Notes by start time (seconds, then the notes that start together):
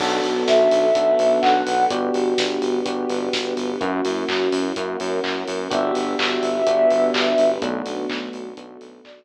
0.00 B1 B3 D4 F#4 A4, kick, crash
0.24 B1, open hi-hat
0.47 B1 E5, kick, snare
0.71 B1, open hi-hat
0.95 B1 B3 D4 F#4 A4 B4, kick, closed hi-hat
1.19 B1, open hi-hat
1.41 B1 F#5, kick, clap
1.67 B1, open hi-hat
1.90 G1 B3 D4 F#4 G4, kick, closed hi-hat
2.14 G1, open hi-hat
2.38 G1, kick, snare
2.62 G1, open hi-hat
2.85 G1 B3 D4 F#4 G4 B4, kick, closed hi-hat
3.09 G1, open hi-hat
3.33 G1, kick, snare
3.57 G1, open hi-hat
3.80 F#2 A#3 C#4 E4 F#4, kick, closed hi-hat
4.05 F#2, open hi-hat
4.29 F#2, kick, clap
4.52 F#2, open hi-hat
4.76 F#2 A#3 C#4 E4 F#4 A#4, kick, closed hi-hat
5.00 F#2, open hi-hat
5.24 F#2, kick, clap
5.48 F#2, open hi-hat
5.70 G1 B3 D4 F#4 G4 E5, kick, closed hi-hat
5.95 G1, open hi-hat
6.19 G1, kick, clap
6.43 G1, open hi-hat
6.67 G1 B3 D4 F#4 G4 B4, kick, closed hi-hat
6.90 G1, open hi-hat
7.14 G1, kick, clap
7.38 G1, open hi-hat
7.62 B1 A3 B3 D4 F#4, kick, closed hi-hat
7.86 B1, open hi-hat
8.09 B1, kick, clap
8.33 B1, open hi-hat
8.57 B1 A3 B3 D4 F#4 A4, kick, closed hi-hat
8.81 B1, open hi-hat
9.04 B1 D5, kick, clap